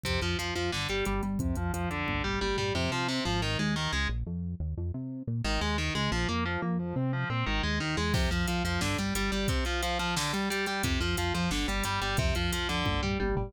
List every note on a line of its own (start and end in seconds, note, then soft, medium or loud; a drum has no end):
0.04 0.19 F2 medium
0.04 0.20 C3 medium
0.04 kick medium
0.04 closed hi-hat medium
0.22 0.36 F2 medium
0.22 0.37 F3 medium
0.22 closed hi-hat soft
0.39 0.53 F2 medium
0.39 0.54 F3 medium
0.39 closed hi-hat medium
0.56 0.70 F2 medium
0.56 0.71 F3 medium
0.56 closed hi-hat medium
0.72 0.87 G1 medium
0.72 0.88 D3 medium
0.72 snare medium
0.89 1.03 G1 medium
0.89 1.05 G3 medium
0.89 closed hi-hat medium
1.05 1.21 G1 medium
1.05 1.21 G3 medium
1.05 closed hi-hat medium
1.23 1.38 G1 medium
1.23 1.38 G3 medium
1.23 closed hi-hat medium
1.39 1.54 F2 medium
1.39 1.55 C3 medium
1.39 kick medium
1.39 closed hi-hat medium
1.56 1.71 F2 medium
1.56 1.72 F3 medium
1.56 closed hi-hat medium
1.73 1.88 F2 medium
1.73 1.89 F3 medium
1.73 closed hi-hat medium
1.90 2.05 F2 medium
1.90 2.23 D3 medium
1.90 closed hi-hat medium
2.07 2.22 G1 medium
2.07 kick medium
2.07 high tom medium
2.24 2.39 G1 medium
2.24 2.39 G3 medium
2.24 floor tom medium
2.41 2.56 G1 medium
2.41 2.56 G3 medium
2.41 high tom medium
2.57 2.72 G1 medium
2.57 2.73 G3 medium
2.57 floor tom medium
2.75 2.89 F2 loud
2.75 2.90 C3 loud
2.92 3.20 C3 loud
2.92 3.07 F3 medium
3.08 3.24 C3 loud
3.25 3.57 G#1 loud
3.25 3.40 F3 loud
3.42 3.57 D#3 loud
3.59 3.88 D#2 loud
3.59 3.74 G#3 medium
3.76 3.91 D#3 loud
3.93 4.07 C#2 medium
3.93 4.08 G#3 loud
4.09 4.24 A#1 loud
4.27 4.55 F2 loud
4.60 4.74 D#2 loud
4.77 4.92 F2 loud
4.94 5.23 C3 loud
5.27 5.42 A#2 loud
5.44 5.59 G#1 loud
5.44 5.60 D#3 loud
5.61 5.90 D#2 medium
5.61 5.76 G#3 medium
5.78 5.93 D#3 medium
5.95 6.09 C#2 loud
5.95 6.10 G#3 medium
6.12 6.26 A#1 loud
6.12 6.27 F3 loud
6.29 6.58 F2 loud
6.29 6.44 A#3 medium
6.46 6.61 F3 loud
6.62 6.94 F2 loud
6.62 6.77 A#3 medium
6.79 6.94 F3 loud
6.96 7.25 C3 loud
6.96 7.11 C4 loud
7.13 7.28 F3 medium
7.30 7.44 A#2 medium
7.30 7.45 C4 medium
7.46 7.61 G#1 loud
7.46 7.62 D#3 loud
7.63 7.80 D#2 loud
7.63 7.79 G#3 medium
7.80 7.96 D#2 loud
7.80 7.96 D#3 medium
7.97 8.13 E2 medium
7.97 8.12 G#3 loud
8.14 8.28 F2 loud
8.14 8.29 C3 loud
8.14 kick loud
8.14 crash loud
8.31 8.45 F2 loud
8.31 8.46 F3 medium
8.31 closed hi-hat medium
8.48 8.62 F2 medium
8.48 8.63 F3 medium
8.48 closed hi-hat loud
8.65 8.79 F2 medium
8.65 8.80 F3 medium
8.65 closed hi-hat medium
8.81 8.96 G1 loud
8.81 8.97 D3 loud
8.81 snare loud
8.98 9.12 G1 medium
8.98 9.14 G3 medium
8.98 closed hi-hat medium
9.15 9.30 G1 medium
9.15 9.31 G3 medium
9.15 closed hi-hat loud
9.32 9.46 G1 medium
9.32 9.47 G3 medium
9.32 closed hi-hat medium
9.48 9.64 C3 medium
9.48 kick loud
9.48 closed hi-hat loud
9.65 9.81 F3 medium
9.65 closed hi-hat medium
9.83 9.98 F3 medium
9.83 closed hi-hat loud
9.99 10.15 F3 medium
9.99 closed hi-hat medium
10.16 10.32 D3 loud
10.16 snare loud
10.33 10.49 G3 medium
10.33 closed hi-hat medium
10.50 10.66 G3 medium
10.50 closed hi-hat loud
10.66 10.82 G3 medium
10.66 closed hi-hat medium
10.83 10.98 F2 medium
10.83 10.99 C3 loud
10.83 kick loud
10.83 closed hi-hat loud
11.01 11.15 F2 loud
11.01 11.16 F3 medium
11.01 closed hi-hat medium
11.17 11.32 F2 medium
11.17 11.33 F3 medium
11.17 closed hi-hat loud
11.34 11.48 F2 medium
11.34 11.50 F3 medium
11.34 closed hi-hat medium
11.51 11.65 G1 medium
11.51 11.66 D3 medium
11.51 snare loud
11.68 11.82 G1 medium
11.68 11.83 G3 medium
11.68 closed hi-hat medium
11.84 11.99 G1 medium
11.84 12.00 G3 medium
11.84 closed hi-hat loud
12.02 12.16 G1 medium
12.02 12.17 G3 medium
12.02 closed hi-hat medium
12.17 12.33 F2 loud
12.17 12.34 C3 loud
12.17 kick loud
12.17 closed hi-hat medium
12.35 12.50 F2 loud
12.35 12.51 F3 medium
12.35 closed hi-hat medium
12.52 12.66 F2 medium
12.52 12.68 F3 medium
12.52 closed hi-hat loud
12.69 12.84 F2 medium
12.69 13.01 D3 loud
12.69 closed hi-hat medium
12.86 13.00 G1 loud
12.86 kick medium
12.86 high tom medium
13.02 13.17 G1 medium
13.02 13.18 G3 medium
13.02 floor tom medium
13.20 13.34 G1 loud
13.20 13.35 G3 medium
13.20 high tom medium
13.36 13.51 G1 loud
13.36 13.52 G3 medium
13.36 floor tom loud